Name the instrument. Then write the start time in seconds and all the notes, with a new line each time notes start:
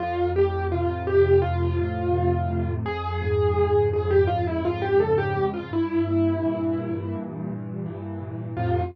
acoustic grand piano
0.00 F2 F4
0.36 A2 G4
0.72 C3 F4
1.07 A2 G4
1.42 F2 F4
1.79 A2
2.15 C3
2.50 A2
2.85 F2 G#4
3.22 G#2
3.57 C#3
3.93 G#2 G#4
4.11 G4
4.27 F2 F4
4.47 E4
4.63 G#2 F4
4.82 G4
5.00 C#3 A4
5.18 G4
5.36 G#2
5.54 F4
5.71 G2 E4
6.07 A#2
6.43 E3
6.78 A#2
7.15 G2
7.49 A#2
7.86 E3
8.21 A#2
8.57 F2 A2 C3 F4